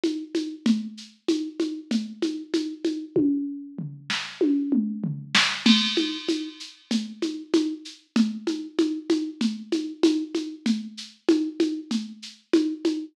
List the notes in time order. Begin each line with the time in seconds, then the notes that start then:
0.04 high conga, shaker
0.35 high conga, shaker
0.66 low conga, shaker
0.97 shaker
1.28 high conga, shaker
1.60 high conga, shaker
1.91 low conga, shaker
2.22 high conga, shaker
2.54 high conga, shaker
2.85 high conga, shaker
3.16 kick, high tom
3.79 floor tom
4.10 snare
4.41 high tom
4.72 mid tom
5.04 floor tom
5.35 snare
5.66 crash, low conga, shaker
5.97 high conga, shaker
6.29 high conga, shaker
6.60 shaker
6.91 low conga, shaker
7.22 high conga, shaker
7.54 high conga, shaker
7.85 shaker
8.16 low conga, shaker
8.47 high conga, shaker
8.79 high conga, shaker
9.10 high conga, shaker
9.41 low conga, shaker
9.72 high conga, shaker
10.03 high conga, shaker
10.35 high conga, shaker
10.66 low conga, shaker
10.97 shaker
11.29 high conga, shaker
11.60 high conga, shaker
11.91 low conga, shaker
12.22 shaker
12.53 high conga, shaker
12.85 high conga, shaker